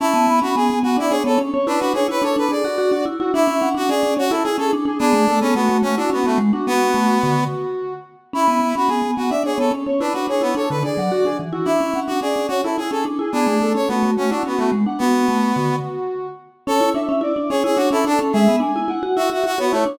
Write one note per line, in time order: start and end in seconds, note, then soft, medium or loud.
0.00 0.14 C#4 medium
0.00 0.40 E4 medium
0.00 0.25 A5 medium
0.14 0.27 B3 medium
0.27 0.41 B3 medium
0.27 0.54 B5 medium
0.42 0.55 C#4 medium
0.42 0.55 F#4 medium
0.56 0.69 B3 medium
0.56 0.79 G#4 medium
0.56 0.80 G#5 medium
0.70 0.83 B3 medium
0.83 0.96 B3 medium
0.83 0.97 F#4 medium
0.83 0.97 F#5 medium
0.97 1.10 D4 medium
0.97 1.12 E4 medium
0.97 1.11 D5 medium
1.10 1.24 D4 medium
1.10 1.23 G#4 medium
1.10 1.24 C#5 medium
1.24 1.38 B3 medium
1.24 1.39 A4 medium
1.24 1.38 C#5 medium
1.38 1.51 C#4 medium
1.53 1.67 C#4 medium
1.53 1.66 C#5 medium
1.67 1.80 D4 medium
1.67 1.80 E4 medium
1.67 1.93 B4 medium
1.79 1.93 D4 medium
1.79 1.93 F#4 medium
1.94 2.07 D4 medium
1.94 2.07 G#4 medium
1.94 2.20 C#5 medium
2.08 2.22 E4 medium
2.08 2.23 B4 medium
2.22 2.35 D4 medium
2.22 2.45 A4 medium
2.22 2.36 C#5 medium
2.36 2.48 D4 medium
2.36 2.51 B4 medium
2.49 2.62 D4 medium
2.49 2.63 G#4 medium
2.49 3.05 D5 medium
2.64 2.77 F#4 medium
2.64 2.78 F#4 medium
2.78 2.91 F#4 medium
2.91 3.05 D4 medium
2.91 3.05 F#4 medium
3.06 3.19 E4 medium
3.19 3.33 E4 medium
3.19 3.33 F#4 medium
3.33 3.47 D4 medium
3.33 3.69 E4 medium
3.33 3.57 E5 medium
3.47 3.61 C#4 medium
3.61 3.75 C#4 medium
3.61 3.84 F#5 medium
3.75 3.88 D4 medium
3.75 3.90 F#4 medium
3.89 4.02 C#4 medium
3.89 4.14 G#4 medium
3.89 4.15 D5 medium
4.03 4.16 C#4 medium
4.17 4.30 C#4 medium
4.17 4.32 F#4 medium
4.17 4.30 C#5 medium
4.30 4.43 E4 medium
4.30 4.44 E4 medium
4.30 4.44 A4 medium
4.44 4.58 E4 medium
4.44 4.57 G#4 medium
4.44 4.58 G#4 medium
4.58 4.71 C#4 medium
4.58 4.71 G#4 medium
4.58 4.71 A4 medium
4.73 4.85 D4 medium
4.85 4.98 D4 medium
4.85 4.99 G#4 medium
4.99 5.13 B3 medium
4.99 5.39 D4 medium
4.99 5.23 G#4 medium
5.13 5.26 A3 medium
5.28 5.41 A3 medium
5.28 5.52 A4 medium
5.41 5.55 B3 medium
5.41 5.54 C#4 medium
5.55 5.68 A3 medium
5.55 5.78 B3 medium
5.55 5.82 F#4 medium
5.69 5.82 A3 medium
5.82 5.96 A3 medium
5.82 5.95 C#4 medium
5.82 5.97 F#4 medium
5.97 6.10 D4 medium
5.97 6.11 E4 medium
5.97 6.10 F#4 medium
6.10 6.26 B3 medium
6.10 6.23 C#4 medium
6.10 6.24 F#4 medium
6.24 6.39 A3 medium
6.24 6.38 B3 medium
6.24 6.38 F#4 medium
6.38 6.51 G#3 medium
6.53 6.66 D4 medium
6.53 6.66 F#4 medium
6.67 7.44 B3 medium
6.67 6.92 B3 medium
6.67 7.14 F#4 medium
6.94 7.17 A3 medium
7.22 7.48 D3 medium
7.22 7.93 F#4 medium
8.33 8.47 C#4 medium
8.33 8.75 E4 medium
8.33 8.58 B5 medium
8.48 8.59 B3 medium
8.60 8.73 B3 medium
8.60 8.87 B5 medium
8.75 8.89 C#4 medium
8.75 8.90 F#4 medium
8.88 9.02 B3 medium
8.88 9.11 G#4 medium
8.88 9.14 G#5 medium
9.02 9.15 B3 medium
9.17 9.30 B3 medium
9.17 9.30 F#4 medium
9.17 9.30 F#5 medium
9.30 9.43 D4 medium
9.30 9.44 D5 medium
9.30 9.43 E5 medium
9.44 9.57 D4 medium
9.44 9.58 G#4 medium
9.44 9.58 C#5 medium
9.58 9.71 B3 medium
9.58 9.72 A4 medium
9.58 9.71 C#5 medium
9.71 9.85 C#4 medium
9.86 10.00 C#4 medium
9.86 9.99 C#5 medium
10.00 10.13 D4 medium
10.00 10.14 E4 medium
10.00 10.27 B4 medium
10.13 10.27 D4 medium
10.13 10.26 F#4 medium
10.27 10.41 D4 medium
10.27 10.42 G#4 medium
10.27 10.54 C#5 medium
10.41 10.55 B3 medium
10.41 10.54 E4 medium
10.55 10.68 D4 medium
10.55 10.79 A4 medium
10.55 10.69 C#5 medium
10.70 10.83 D3 medium
10.70 10.83 B4 medium
10.83 10.96 D4 medium
10.83 10.97 G#4 medium
10.83 11.38 D5 medium
10.97 11.10 F#3 medium
10.97 11.11 F#5 medium
11.11 11.24 F#4 medium
11.11 11.25 F#4 medium
11.25 11.38 D4 medium
11.25 11.38 G#4 medium
11.39 11.53 E3 medium
11.53 11.66 E4 medium
11.53 11.66 F#4 medium
11.65 11.79 D4 medium
11.65 12.00 E4 medium
11.65 11.90 E5 medium
11.80 11.93 C#4 medium
11.94 12.07 C#4 medium
11.94 12.17 F#5 medium
12.07 12.21 D4 medium
12.07 12.20 F#4 medium
12.21 12.34 C#4 medium
12.21 12.47 G#4 medium
12.21 12.48 D5 medium
12.36 12.48 C#4 medium
12.48 12.62 C#4 medium
12.48 12.61 F#4 medium
12.48 12.63 C#5 medium
12.64 12.77 E4 medium
12.64 12.77 A4 medium
12.78 12.91 E4 medium
12.78 12.91 G#4 medium
12.91 13.04 C#4 medium
12.91 13.05 G#4 medium
12.91 13.05 A4 medium
13.05 13.18 D4 medium
13.19 13.32 E4 medium
13.19 13.33 G#4 medium
13.32 13.46 B3 medium
13.32 13.73 D4 medium
13.32 13.56 G#4 medium
13.47 13.60 A3 medium
13.61 13.74 A3 medium
13.61 13.86 A4 medium
13.75 13.88 C#4 medium
13.75 13.89 C#5 medium
13.88 14.02 A3 medium
13.88 14.11 B3 medium
13.88 14.15 F#4 medium
14.03 14.16 A3 medium
14.17 14.30 A3 medium
14.17 14.30 C#4 medium
14.17 14.30 F#4 medium
14.30 14.43 D4 medium
14.30 14.45 E4 medium
14.30 14.44 F#4 medium
14.43 14.59 B3 medium
14.43 14.56 C#4 medium
14.43 14.58 F#4 medium
14.57 14.70 A3 medium
14.57 14.72 B3 medium
14.57 14.72 F#4 medium
14.72 14.85 G#3 medium
14.86 15.00 D4 medium
14.86 14.99 F#5 medium
14.98 15.76 B3 medium
14.98 15.25 B3 medium
14.98 15.47 F#4 medium
15.28 15.51 A3 medium
15.56 15.80 D3 medium
15.56 16.27 F#4 medium
16.67 16.80 C#4 medium
16.67 16.90 A4 medium
16.67 16.93 C#5 medium
16.81 16.94 E4 medium
16.94 17.08 D4 medium
16.94 17.08 E5 medium
17.08 17.22 C#4 medium
17.08 17.22 E5 medium
17.21 17.34 E4 medium
17.21 17.49 D5 medium
17.36 17.49 D4 medium
17.50 17.63 C#4 medium
17.50 17.63 G#4 medium
17.50 17.87 C#5 medium
17.64 17.77 E4 medium
17.64 17.78 G#4 medium
17.76 17.90 D4 medium
17.76 17.89 F#4 medium
17.91 18.04 C#4 medium
17.91 18.05 E4 medium
17.91 18.05 A4 medium
18.05 18.18 D4 medium
18.05 18.20 D4 medium
18.05 18.31 A4 medium
18.19 18.32 C#4 medium
18.33 18.47 G#3 loud
18.33 18.56 G#4 medium
18.33 18.60 E5 medium
18.48 18.61 B3 medium
18.60 18.73 D4 medium
18.60 18.74 G#5 medium
18.75 18.88 E4 medium
18.75 18.88 G#5 medium
18.88 19.01 E4 medium
18.88 19.15 F#5 medium
19.03 19.16 F#4 medium
19.16 19.30 E4 medium
19.16 19.30 F#4 medium
19.16 19.51 E5 medium
19.30 19.43 F#4 medium
19.30 19.45 F#4 medium
19.44 19.57 F#4 medium
19.44 19.59 F#4 medium
19.58 19.72 B3 medium
19.58 19.72 F#4 medium
19.58 19.72 C#5 medium
19.71 19.84 A3 medium
19.71 19.86 E4 medium
19.71 19.98 C#5 medium
19.86 19.98 D4 medium